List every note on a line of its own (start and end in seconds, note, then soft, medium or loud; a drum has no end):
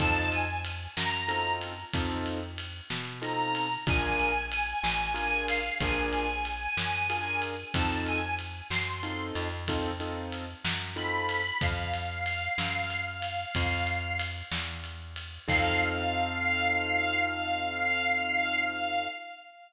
0.00 0.87 F2 loud
0.00 0.45 C4 medium
0.00 0.45 D#4 loud
0.00 0.45 F4 medium
0.00 0.45 A4 loud
0.00 0.29 A5 medium
0.00 kick loud
0.00 ride loud
0.32 0.59 G#5 medium
0.32 ride medium
0.65 ride loud
0.96 1.84 F#2 medium
0.96 1.53 A#5 medium
0.96 snare loud
1.28 1.74 C4 medium
1.28 1.74 D#4 medium
1.28 1.74 F4 medium
1.28 1.74 A4 medium
1.28 ride medium
1.61 ride medium
1.93 2.81 F2 loud
1.93 2.39 C4 loud
1.93 2.39 D#4 loud
1.93 2.39 F4 medium
1.93 2.39 A4 loud
1.93 kick loud
1.93 ride loud
2.26 ride medium
2.58 ride loud
2.90 3.77 B2 medium
2.90 snare loud
3.22 3.67 C4 medium
3.22 3.67 D#4 medium
3.22 3.67 F4 medium
3.22 3.67 A4 medium
3.22 3.75 A#5 medium
3.22 ride medium
3.55 ride medium
3.87 4.74 A#1 loud
3.87 4.32 D4 loud
3.87 4.32 F4 loud
3.87 4.32 G#4 medium
3.87 4.32 A#4 loud
3.87 4.42 G#5 medium
3.87 kick loud
3.87 ride loud
4.19 ride medium
4.52 5.45 G#5 medium
4.52 ride loud
4.83 5.71 A1 medium
4.83 snare loud
5.14 5.60 D4 medium
5.14 5.60 F4 medium
5.14 5.60 G#4 medium
5.14 5.60 A#4 medium
5.14 ride medium
5.48 5.76 F5 medium
5.48 ride loud
5.81 6.68 A#1 loud
5.81 6.27 D4 loud
5.81 6.27 F4 loud
5.81 6.27 G#4 loud
5.81 6.27 A#4 medium
5.81 7.42 G#5 medium
5.81 kick loud
5.81 ride loud
6.13 ride medium
6.45 ride medium
6.77 7.64 F#2 medium
6.77 snare loud
7.10 7.55 D4 medium
7.10 7.55 F4 medium
7.10 7.55 G#4 loud
7.10 7.55 A#4 medium
7.10 ride medium
7.42 ride medium
7.74 8.62 F2 loud
7.74 8.20 C4 medium
7.74 8.20 D#4 loud
7.74 8.20 F4 medium
7.74 8.20 A4 loud
7.74 8.01 A5 medium
7.74 kick loud
7.74 ride loud
8.06 8.34 G#5 medium
8.06 ride medium
8.39 ride medium
8.70 9.32 F#2 medium
8.70 9.25 C6 medium
8.70 snare loud
9.03 9.48 C4 medium
9.03 9.48 D#4 medium
9.03 9.48 F4 medium
9.03 9.48 A4 medium
9.03 ride medium
9.35 10.55 F2 loud
9.35 ride medium
9.68 9.91 C4 loud
9.68 9.91 D#4 loud
9.68 9.91 F4 medium
9.68 9.91 A4 loud
9.68 kick medium
9.68 ride loud
10.00 10.45 C4 medium
10.00 10.45 D#4 medium
10.00 10.45 F4 medium
10.00 10.45 A4 medium
10.00 ride medium
10.32 ride medium
10.65 11.52 F#2 medium
10.65 snare loud
10.96 11.41 C4 medium
10.96 11.41 D#4 medium
10.96 11.41 F4 medium
10.96 11.41 A4 medium
10.96 11.58 B5 medium
10.96 ride medium
11.29 ride medium
11.61 12.49 F2 loud
11.61 14.20 F5 medium
11.61 kick loud
11.61 ride loud
11.94 ride medium
12.26 ride medium
12.58 13.45 F#2 medium
12.58 snare loud
12.90 ride medium
13.22 ride medium
13.55 14.43 F2 loud
13.55 kick loud
13.55 ride loud
13.87 ride medium
14.19 ride loud
14.51 15.39 E2 medium
14.51 snare loud
14.84 ride medium
15.16 ride loud
15.48 19.08 F2 loud
15.48 19.07 C4 medium
15.48 19.07 D#4 medium
15.48 19.07 F4 medium
15.48 19.07 A4 loud
15.48 19.08 F5 loud
15.48 kick loud
15.48 crash loud